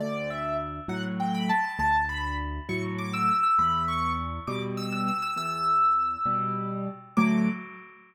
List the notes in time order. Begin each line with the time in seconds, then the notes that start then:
0.00 D2 D5
0.30 E5
0.88 A2 F#3 F#5
1.20 G5
1.35 B5
1.49 A5
1.64 A5
1.79 D2 A5
2.09 B5
2.69 A2 F#3 C#6
2.98 D6
3.14 E6
3.28 E6
3.43 E6
3.59 E2 B5
3.88 C#6
4.47 B2 G3 D6
4.77 E6
4.93 E6
5.08 E6
5.22 E6
5.36 E2 E6
6.26 B2 G3
7.17 D2 A2 F#3 D6